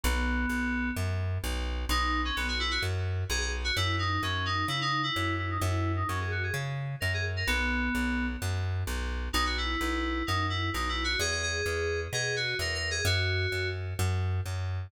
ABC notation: X:1
M:4/4
L:1/16
Q:1/4=129
K:B
V:1 name="Electric Piano 2"
B,8 z8 | D3 C B, F E F z4 G G z F | E2 D2 C2 D2 E D2 E3 E D | E3 D C G F G z4 A G z A |
B,8 z8 | D F E6 D2 E2 (3D2 E2 F2 | G G G6 G2 F2 (3A2 A2 G2 | F6 z10 |]
V:2 name="Electric Bass (finger)" clef=bass
B,,,4 B,,,4 F,,4 B,,,4 | B,,,4 B,,,4 F,,4 B,,,4 | F,,4 F,,4 C,4 F,,4 | F,,4 F,,4 C,4 F,,4 |
B,,,4 B,,,4 F,,4 B,,,4 | B,,,4 B,,,4 F,,4 B,,,4 | E,,4 E,,4 B,,4 E,,4 | F,,4 F,,4 F,,4 F,,4 |]